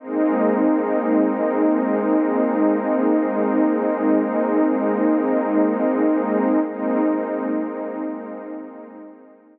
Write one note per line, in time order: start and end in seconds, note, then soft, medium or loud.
0.00 6.60 G#3 medium
0.00 6.60 A#3 medium
0.00 6.60 C4 medium
0.00 6.60 D#4 medium
6.66 9.59 G#3 medium
6.66 9.59 A#3 medium
6.66 9.59 C4 medium
6.66 9.59 D#4 medium